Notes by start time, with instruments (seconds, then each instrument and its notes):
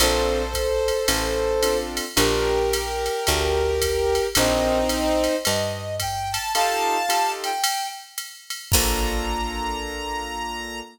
0.00 electric bass (finger) A#1, acoustic grand piano C4 D4 F4 A4, brass section A4 C5, ride
0.54 kick, hi-hat pedal, ride
0.88 ride
1.08 electric bass (finger) A1, ride
1.63 acoustic grand piano C4 D4 F4 A4, hi-hat pedal, ride
1.97 ride
2.16 electric bass (finger) A#1, acoustic grand piano D4 F4 G4 A#4, brass section G4 A#4, ride
2.73 hi-hat pedal, ride
3.06 ride
3.27 electric bass (finger) D2, kick, ride
3.82 kick, hi-hat pedal, ride
4.15 ride
4.35 electric bass (finger) A#1, brass section C4 D#4, acoustic grand piano C4 D#4 G4 A#4, kick, ride
4.89 hi-hat pedal, ride
5.24 ride
5.45 electric bass (finger) G2, brass section D#5, ride
6.00 brass section G5, kick, hi-hat pedal, ride
6.32 brass section A5, ride
6.54 acoustic grand piano D#4 F4 G4 A4, brass section F5 A5, ride
7.09 acoustic grand piano D#4 F4 G4 A4, hi-hat pedal, ride
7.44 brass section G5, ride
7.64 ride
8.18 hi-hat pedal, ride
8.50 ride
8.71 electric bass (finger) A#1, acoustic grand piano A#3 D4 F4 A4, brass section A#5, kick, crash